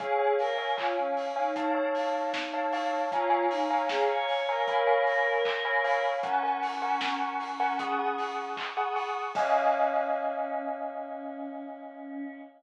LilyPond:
<<
  \new Staff \with { instrumentName = "Choir Aahs" } { \time 4/4 \key des \major \tempo 4 = 77 aes'8 bes'8 f'16 des'8 ees'2~ ees'16 | f'8 ees'8 aes'16 des''8 bes'2~ bes'16 | des'2. r4 | des'1 | }
  \new Staff \with { instrumentName = "Tubular Bells" } { \time 4/4 \key des \major <des'' f'' aes''>16 <des'' f'' aes''>8 <des'' f'' aes''>16 <des'' f'' aes''>8. <des'' f'' aes''>16 <des'' f'' a''>16 <des'' f'' a''>4 <des'' f'' a''>16 <des'' f'' a''>8 | <des'' f'' aes'' bes''>16 <des'' f'' aes'' bes''>8 <des'' f'' aes'' bes''>16 <des'' f'' aes'' bes''>8. <des'' f'' aes'' bes''>16 <des'' f'' aes'' ces'''>16 <des'' f'' aes'' ces'''>4 <des'' f'' aes'' ces'''>16 <des'' f'' aes'' ces'''>8 | <bes' ges'' aes'' des'''>16 <bes' ges'' aes'' des'''>8 <bes' ges'' aes'' des'''>16 <bes' ges'' aes'' des'''>8. <bes' ges'' aes'' des'''>16 <aes' ges'' des''' ees'''>16 <aes' ges'' des''' ees'''>4 <aes' ges'' des''' ees'''>16 <aes' ges'' des''' ees'''>8 | <des' ees'' f'' aes''>1 | }
  \new DrumStaff \with { instrumentName = "Drums" } \drummode { \time 4/4 <hh bd>8 hho8 <hc bd>8 hho8 <hh bd>8 hho8 <bd sn>8 hho8 | <hh bd>8 hho8 <bd sn>8 hho8 <hh bd>8 hho8 <hc bd>8 hho8 | <hh bd>8 hho8 <bd sn>8 hho8 <hh bd>8 hho8 <hc bd>8 hho8 | <cymc bd>4 r4 r4 r4 | }
>>